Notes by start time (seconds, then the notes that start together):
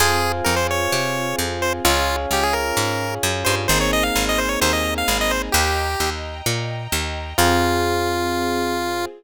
0.00 F2 C4 F4 G#4 C5 F5 G#5
0.44 F2 A#4
0.56 C5
0.71 C#5
0.92 C3
1.39 F2
1.62 C5
1.85 C#2 C#4 F4 G#4 C#5 F5 G#5
2.31 C#2 G4
2.43 G#4
2.53 A#4
2.77 G#2
3.23 F#2
3.45 G2 C5
3.68 G#1 A#3 C4 D#4 G#4 C5 D#5 G#5 A#5
3.81 C#5
3.93 D#5
4.03 F5
4.15 G#1
4.29 D#5
4.38 C5
4.49 C#5
4.61 D#2 C5
4.73 D#5
4.98 F5
5.08 G#1
5.21 D#5
5.31 C5
5.52 D#2 G4 D#5 G5 A#5
6.00 D#2
6.46 A#2
6.92 D#2
7.38 F2 C4 F4 G#4